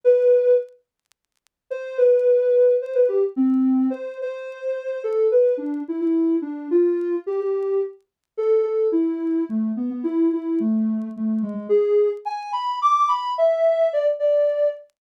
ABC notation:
X:1
M:3/4
L:1/16
Q:1/4=108
K:A
V:1 name="Ocarina"
B4 z8 | [K:Am] c2 B6 c B G z | C4 c2 c6 | A2 B2 D2 E E3 D2 |
F4 G G3 z4 | [K:A] A2 A2 E4 A,2 B, B, | E2 E2 A,4 A,2 G, G, | G3 z g2 b2 d'2 b2 |
e4 d z d4 z2 |]